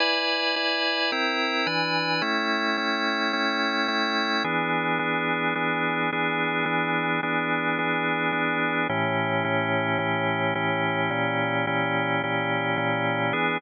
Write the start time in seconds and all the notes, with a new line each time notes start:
0.00 E4 B4 D5 G#5
0.56 E4 B4 D5 G#5
1.12 C4 E4 A#4 G5
1.67 E3 D4 B4 G#5
2.22 A3 C#4 E4 G5
2.77 A3 C#4 E4 G5
3.33 A3 C#4 E4 G5
3.88 A3 C#4 E4 G5
4.44 E3 B3 D4 G#4
4.99 E3 B3 D4 G#4
5.55 E3 B3 D4 G#4
6.13 E3 B3 D4 G#4
6.66 E3 B3 D4 G#4
7.23 E3 B3 D4 G#4
7.79 E3 B3 D4 G#4
8.32 E3 B3 D4 G#4
8.89 A2 E3 C#4 G4
9.44 A2 E3 C#4 G4
9.99 A2 E3 C#4 G4
10.55 A2 E3 C#4 G4
11.11 A#2 E3 C#4 G4
11.67 A#2 E3 C#4 G4
12.23 A#2 E3 C#4 G4
12.77 A#2 E3 C#4 G4
13.33 E3 B3 D4 G#4